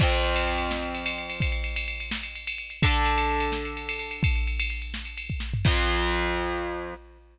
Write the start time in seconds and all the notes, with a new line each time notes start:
0.00 F2 F3 C4, kick, crash
0.12 ride
0.24 ride
0.36 ride
0.47 ride
0.58 ride
0.71 snare
0.83 ride
0.95 ride
1.06 ride
1.18 ride
1.30 ride
1.40 kick, ride
1.52 ride
1.64 ride
1.76 ride
1.88 ride
2.00 ride
2.11 snare
2.23 ride
2.35 ride
2.47 ride
2.58 ride
2.70 ride
2.82 D3 D4 A4, kick, ride
2.94 ride
3.05 ride
3.18 ride
3.29 ride
3.40 ride
3.52 snare
3.65 ride
3.77 ride
3.89 ride
3.99 ride
4.11 ride
4.23 kick, ride
4.35 ride
4.47 ride
4.60 ride
4.70 ride
4.82 ride
4.94 snare
5.05 ride
5.17 ride
5.30 kick
5.40 snare
5.54 floor tom
5.65 F2 F3 C4, kick, crash